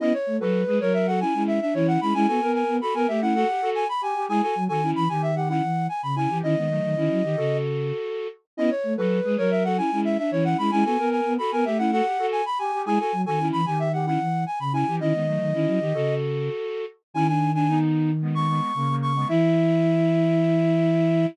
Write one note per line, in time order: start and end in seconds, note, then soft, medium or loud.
0.00 0.13 B3 medium
0.00 0.13 C#4 medium
0.00 0.13 E4 medium
0.00 0.13 D#5 loud
0.13 0.37 C#5 medium
0.27 0.39 A3 medium
0.40 0.64 F#3 medium
0.40 0.62 F#4 medium
0.40 0.62 A4 medium
0.40 0.78 B4 medium
0.67 0.79 G#3 medium
0.67 0.80 G#4 medium
0.67 0.80 B4 medium
0.80 1.24 F#3 medium
0.80 1.07 A#4 medium
0.80 0.93 C#5 loud
0.94 1.06 E5 medium
1.07 1.20 F#4 medium
1.07 1.20 A4 medium
1.07 1.20 F#5 medium
1.20 1.33 C#4 medium
1.20 1.33 E4 medium
1.20 1.43 G#5 medium
1.34 1.60 G#3 medium
1.34 1.59 C#4 medium
1.34 1.59 E4 medium
1.47 1.60 E5 medium
1.61 1.74 D4 medium
1.61 1.74 E5 medium
1.74 1.98 E3 medium
1.74 1.99 C#4 medium
1.74 1.99 E4 medium
1.74 1.87 C#5 loud
1.88 2.00 F#5 loud
2.01 2.14 G#3 medium
2.01 2.14 C#4 medium
2.01 2.14 E4 medium
2.01 2.14 B5 loud
2.14 2.27 G#3 loud
2.14 2.27 C#4 medium
2.14 2.27 E4 medium
2.14 2.27 G#5 loud
2.27 2.40 B3 medium
2.27 2.40 F#4 medium
2.27 2.40 A4 medium
2.27 2.52 G#5 loud
2.41 2.64 B3 medium
2.41 2.77 A#4 medium
2.54 2.76 G#5 medium
2.68 2.80 B3 medium
2.81 2.94 F#4 medium
2.81 2.94 A4 medium
2.81 2.94 B5 medium
2.94 3.07 B3 medium
2.94 3.07 A#4 medium
2.94 3.07 G#5 medium
3.08 3.44 A3 medium
3.08 3.21 G4 medium
3.08 3.21 E5 medium
3.21 3.34 C#4 medium
3.21 3.34 E4 medium
3.21 3.34 F#5 loud
3.35 3.47 F#4 medium
3.35 3.47 A4 medium
3.35 3.70 F#5 loud
3.48 3.61 G4 medium
3.62 3.84 F#4 medium
3.62 3.84 A4 medium
3.75 3.88 G#5 loud
3.89 4.02 B5 loud
4.01 4.14 G4 medium
4.01 4.25 G#5 medium
4.15 4.28 G4 medium
4.29 4.41 G#3 medium
4.29 4.42 E4 medium
4.29 4.42 G#4 medium
4.29 4.42 G#5 loud
4.42 4.54 F#4 medium
4.42 4.54 A4 medium
4.42 4.64 G#5 medium
4.55 4.68 F#3 medium
4.68 4.93 D#3 medium
4.68 4.81 F#4 medium
4.68 4.81 A4 medium
4.68 4.91 G#5 loud
4.82 5.04 C#4 medium
4.82 5.04 E4 medium
4.96 5.08 E3 medium
4.96 5.08 B5 loud
5.09 5.61 D#3 medium
5.09 5.31 G4 medium
5.09 5.22 G#5 medium
5.22 5.35 E5 medium
5.36 5.48 G4 medium
5.36 5.48 F#5 medium
5.49 5.62 C#4 medium
5.49 5.62 E4 medium
5.49 5.87 F#5 medium
5.62 5.88 E3 medium
5.89 6.02 G#5 medium
6.03 6.27 C#3 medium
6.03 6.15 B5 medium
6.16 6.29 C#4 medium
6.16 6.29 E4 medium
6.16 6.38 G#5 medium
6.29 6.42 E3 medium
6.29 6.42 G4 medium
6.43 6.55 D#3 loud
6.43 6.56 C#4 medium
6.43 6.56 E4 medium
6.43 7.57 D#5 loud
6.56 6.80 D#3 medium
6.56 6.69 G#3 medium
6.56 6.69 B3 medium
6.70 6.95 F#3 medium
6.70 6.95 A3 medium
6.83 6.95 D#3 medium
6.96 7.09 D#3 medium
6.96 7.22 C#4 medium
6.96 7.22 E4 medium
7.10 7.23 F#3 medium
7.23 7.36 D#3 medium
7.23 7.36 G4 medium
7.37 7.92 C#3 medium
7.37 8.27 F#4 medium
7.37 8.27 A4 medium
8.57 8.70 B3 medium
8.57 8.70 C#4 medium
8.57 8.70 E4 medium
8.57 8.70 D#5 loud
8.70 8.94 C#5 medium
8.83 8.96 A3 medium
8.97 9.21 F#3 medium
8.97 9.19 F#4 medium
8.97 9.19 A4 medium
8.97 9.35 B4 medium
9.24 9.37 G#3 medium
9.24 9.37 G#4 medium
9.24 9.37 B4 medium
9.37 9.81 F#3 medium
9.37 9.63 A#4 medium
9.37 9.50 C#5 loud
9.51 9.64 E5 medium
9.64 9.77 F#4 medium
9.64 9.77 A4 medium
9.64 9.77 F#5 medium
9.77 9.90 C#4 medium
9.77 9.90 E4 medium
9.77 10.00 G#5 medium
9.91 10.17 G#3 medium
9.91 10.17 C#4 medium
9.91 10.17 E4 medium
10.05 10.17 E5 medium
10.18 10.31 D4 medium
10.18 10.31 E5 medium
10.31 10.55 E3 medium
10.31 10.57 C#4 medium
10.31 10.57 E4 medium
10.31 10.44 C#5 loud
10.45 10.57 F#5 loud
10.58 10.71 G#3 medium
10.58 10.71 C#4 medium
10.58 10.71 E4 medium
10.58 10.71 B5 loud
10.71 10.84 G#3 loud
10.71 10.84 C#4 medium
10.71 10.84 E4 medium
10.71 10.84 G#5 loud
10.84 10.97 B3 medium
10.84 10.97 F#4 medium
10.84 10.97 A4 medium
10.84 11.09 G#5 loud
10.98 11.21 B3 medium
10.98 11.34 A#4 medium
11.11 11.33 G#5 medium
11.25 11.38 B3 medium
11.38 11.51 F#4 medium
11.38 11.51 A4 medium
11.38 11.51 B5 medium
11.52 11.65 B3 medium
11.52 11.64 A#4 medium
11.52 11.65 G#5 medium
11.65 12.01 A3 medium
11.65 11.78 G4 medium
11.65 11.78 E5 medium
11.78 11.91 C#4 medium
11.78 11.91 E4 medium
11.78 11.91 F#5 loud
11.92 12.05 F#4 medium
11.92 12.05 A4 medium
11.92 12.27 F#5 loud
12.05 12.18 G4 medium
12.19 12.41 F#4 medium
12.19 12.41 A4 medium
12.32 12.45 G#5 loud
12.46 12.58 B5 loud
12.59 12.72 G4 medium
12.59 12.82 G#5 medium
12.72 12.85 G4 medium
12.86 12.98 G#3 medium
12.86 12.98 E4 medium
12.86 12.98 G#4 medium
12.86 12.99 G#5 loud
12.99 13.12 F#4 medium
12.99 13.12 A4 medium
12.99 13.22 G#5 medium
13.12 13.25 F#3 medium
13.26 13.51 D#3 medium
13.26 13.39 F#4 medium
13.26 13.39 A4 medium
13.26 13.48 G#5 loud
13.39 13.61 C#4 medium
13.39 13.61 E4 medium
13.52 13.66 E3 medium
13.52 13.65 B5 loud
13.66 14.18 D#3 medium
13.66 13.88 G4 medium
13.66 13.79 G#5 medium
13.79 13.92 E5 medium
13.93 14.06 G4 medium
13.93 14.06 F#5 medium
14.06 14.19 C#4 medium
14.06 14.19 E4 medium
14.06 14.44 F#5 medium
14.20 14.45 E3 medium
14.46 14.59 G#5 medium
14.59 14.84 C#3 medium
14.59 14.73 B5 medium
14.73 14.86 C#4 medium
14.73 14.86 E4 medium
14.73 14.95 G#5 medium
14.87 15.00 E3 medium
14.87 15.00 G4 medium
15.00 15.13 D#3 loud
15.00 15.13 C#4 medium
15.00 15.13 E4 medium
15.00 16.15 D#5 loud
15.13 15.38 D#3 medium
15.13 15.26 G#3 medium
15.13 15.26 B3 medium
15.27 15.53 F#3 medium
15.27 15.53 A3 medium
15.40 15.53 D#3 medium
15.54 15.67 D#3 medium
15.54 15.79 C#4 medium
15.54 15.79 E4 medium
15.66 15.79 F#3 medium
15.80 15.93 D#3 medium
15.80 15.93 G4 medium
15.94 16.49 C#3 medium
15.94 16.85 F#4 medium
15.94 16.85 A4 medium
17.14 18.60 D#3 medium
17.14 17.27 C#4 medium
17.14 17.27 E4 medium
17.14 17.27 G#5 loud
17.28 17.50 D4 medium
17.28 17.51 G#5 medium
17.54 17.67 D4 medium
17.54 17.79 G#5 medium
17.68 18.11 B3 medium
17.68 18.11 D#4 medium
18.22 18.34 G#3 medium
18.22 18.34 B3 medium
18.35 18.48 G#3 medium
18.35 18.48 B3 medium
18.35 18.96 C#6 medium
18.48 18.72 G#3 medium
18.48 18.72 B3 medium
18.75 19.25 C#3 medium
18.75 18.88 A#3 medium
18.89 19.12 A#3 medium
19.02 19.28 C#6 medium
19.15 19.28 G#3 medium
19.15 19.28 B3 medium
19.28 21.26 E3 loud
19.28 21.26 E4 loud
19.28 21.26 E5 loud